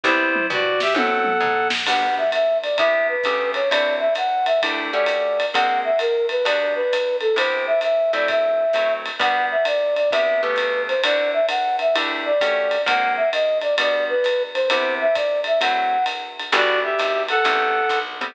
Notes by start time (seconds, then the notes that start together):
0.04 C2 G3 B3 C4 E4 C5, kick
0.35 mid tom
0.50 G2 F#4 D5, floor tom
0.80 G4 E5, snare
0.94 F#2 F#3 A3 C4 E4 A4 F#5, high tom
1.24 mid tom
1.40 G#2, floor tom
1.70 snare
1.86 G3 B3 D4 F#4 F#5, crash, ride
2.18 E5
2.32 E5, hi-hat pedal, ride
2.62 D5, ride
2.78 C3 B3 E4 G4 E5, kick, ride
3.08 B4
3.24 C#3 A3 B3 G4, kick, hi-hat pedal, ride
3.54 C#5, ride
3.71 D3 C4 E4 F#4 D5, ride
4.00 E5
4.15 F#5, hi-hat pedal, ride
4.46 E5, ride
4.62 A3 D4 E4 G4, kick, ride
4.92 A3 C#4 F#4 G4 D5
5.06 hi-hat pedal, ride
5.40 ride
5.54 G#3 A#3 C4 F#4 F#5, kick, ride
5.84 E5
5.99 A#4, hi-hat pedal, ride
6.29 B4, ride
6.45 G3 B3 D4 F#4 D5, ride
6.75 B4
6.93 hi-hat pedal, ride
7.21 A4, ride
7.36 C3 B3 E4 G4 C5, ride
7.67 E5
7.81 E5, hi-hat pedal, ride
8.13 F#3 A3 C4 E4 D5, ride
8.28 E5, kick, ride
8.73 F#3 A3 C4 E4, hi-hat pedal, ride
9.06 ride
9.19 G3 B3 D4 F#4 F#5, kick, ride
9.51 E5
9.65 D5, hi-hat pedal, ride
9.96 D5, ride
10.11 C3 B3 E4 G4 E5, kick, ride
10.42 C#3 A3 B3 G4 B4
10.56 hi-hat pedal, ride
10.88 C5, ride
11.04 D3 C4 E4 F#4 D5, ride
11.33 E5
11.49 F#5, hi-hat pedal, ride
11.79 E5, ride
11.95 A3 D4 E4 G4, ride
12.25 D5
12.41 A3 C#4 F#4 G4, kick, hi-hat pedal, ride
12.71 ride
12.86 G#3 A#3 C4 F#4 F#5, kick, ride
13.17 E5
13.33 D#5, hi-hat pedal, ride
13.61 D5, ride
13.78 G3 B3 D4 F#4 D5, ride
14.09 B4
14.24 hi-hat pedal, ride
14.54 C5, ride
14.70 C3 B3 E4 G4 C5, ride
15.01 E5
15.15 D5, kick, hi-hat pedal, ride
15.44 E5, ride
15.61 F#3 A3 C4 E4 F#5, ride
16.06 hi-hat pedal, ride
16.39 ride
16.52 G1 G3 B3 D4 E4 F#4 D5, ride
16.83 G4 E5
16.99 G#1, hi-hat pedal, ride
17.28 A4 F#5, ride
17.44 A1 G3 A3 B3 C4, kick, ride
17.89 B1, kick, hi-hat pedal, ride
18.21 G3 A3 B3 C4, ride